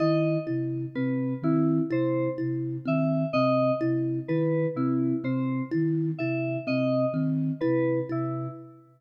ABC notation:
X:1
M:9/8
L:1/8
Q:3/8=42
K:none
V:1 name="Flute" clef=bass
_E, C, C, E, C, C, E, C, C, | _E, C, C, E, C, C, E, C, C, |]
V:2 name="Kalimba"
E E C C E E C C E | E C C E E C C E E |]
V:3 name="Electric Piano 2"
_e z B =E c z =e _e z | B E c z e _e z B =E |]